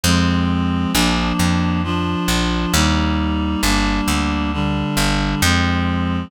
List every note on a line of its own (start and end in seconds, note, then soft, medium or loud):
0.04 0.86 F2 loud
0.04 0.92 F3 medium
0.04 0.92 G#3 medium
0.04 0.92 C4 medium
0.93 1.33 A#1 loud
0.93 1.82 F3 medium
0.93 1.82 A#3 medium
0.93 1.82 D4 medium
1.39 2.15 F2 medium
1.84 2.73 F3 medium
1.84 2.73 D4 medium
1.84 2.73 F4 medium
2.28 2.66 A#1 medium
2.73 3.56 D#2 loud
2.73 3.61 G3 medium
2.73 3.61 A#3 medium
2.73 3.61 D#4 medium
3.63 4.01 G1 medium
3.63 4.51 G3 medium
3.63 4.51 A#3 medium
3.63 4.51 D4 medium
4.08 4.84 D2 medium
4.53 5.41 D3 medium
4.53 5.41 G3 medium
4.53 5.41 D4 medium
4.97 5.35 G1 medium
5.42 6.25 F2 loud
5.42 6.30 F3 medium
5.42 6.30 G#3 medium
5.42 6.30 C4 medium